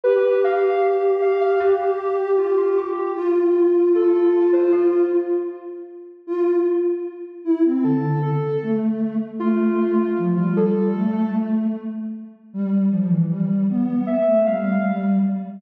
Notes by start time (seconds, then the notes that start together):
0.04 G4 B4
0.44 F5
1.22 F5
1.41 F5
1.60 G4
2.38 F4
2.57 F4
2.77 G4
3.15 F4
3.95 A4
4.53 C5
4.72 F4
6.27 F4
7.44 E4
7.65 C4
7.84 D3 A4
8.22 A4
8.63 A3
9.40 A3 F4
10.18 F3
10.37 G3 F4
10.56 A4
10.76 G3
10.95 A3
12.53 G3
12.90 F3
13.08 E3
13.29 G3
13.69 B3
14.07 E5
14.27 A3
14.46 G3 F5
14.87 G3